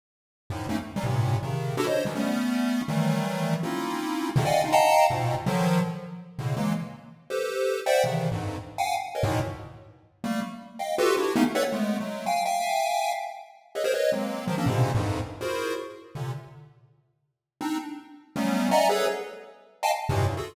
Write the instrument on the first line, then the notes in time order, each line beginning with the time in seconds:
lead 1 (square)
0.50 F#2 G#2 A2 A#2
0.69 A3 A#3 C4 C#4 D#4
0.96 E3 F#3 G3
1.04 G2 A2 A#2 C3
1.43 C3 C#3 D#3
1.77 D4 E4 F#4 G4 A4
1.87 C5 C#5 D#5
2.05 D#3 E3 F3 F#3 G3
2.15 G3 A3 B3 C#4
2.88 D#3 E3 F#3 G3 A3
3.63 A#3 C4 C#4 D#4 E4 F4
4.36 B2 C3 C#3 D3 D#3
4.45 D5 D#5 F5 F#5 G5 G#5
4.64 C#4 D4 D#4 F4
4.72 D#5 F5 F#5 G5 A5 A#5
5.10 G#2 A#2 B2
5.46 D3 D#3 F3 F#3
6.38 A2 B2 C#3 D3
6.57 E3 F#3 G#3 A#3
7.30 G4 A4 B4 C5
7.86 C5 D5 E5 F#5 G5
8.04 C3 C#3 D#3 E3
8.32 F2 G2 G#2
8.78 F5 F#5 G5 G#5
9.15 A#4 B4 C#5 D#5
9.23 G#2 A2 A#2 B2
10.24 G3 A3 A#3
10.79 D#5 F5 G5
10.98 F4 F#4 G4 A4 B4
11.17 D4 E4 F#4 G4
11.36 A3 A#3 B3 C#4 D#4
11.55 A4 B4 C#5 D5 E5 F#5
11.72 G#3 A3 B3
12.00 F#3 G#3 A3
12.26 F5 G5 G#5
12.45 E5 F5 G5 G#5
13.75 G#4 A4 B4 C#5 D#5 E5
13.84 G#4 A#4 C5 C#5
13.94 B4 C#5 D#5
14.12 F#3 G#3 A#3 C4
14.47 D#3 F3 F#3
14.58 A#3 C4 C#4 D4
14.66 G#2 A#2 B2 C3 C#3 D3
14.95 F2 F#2 G2 G#2
15.41 E4 F4 F#4 G#4 A#4 C5
16.15 A#2 C3 D3
17.61 C4 D4 D#4
18.36 F#3 G3 A3 B3 C#4
18.71 D5 D#5 E5 F#5 G#5 A#5
18.89 G#4 A4 B4 C#5
19.83 D#5 F5 G5 G#5 A5
20.09 G2 A2 A#2 B2 C3
20.27 F#2 G2 G#2
20.37 F4 F#4 G#4 A4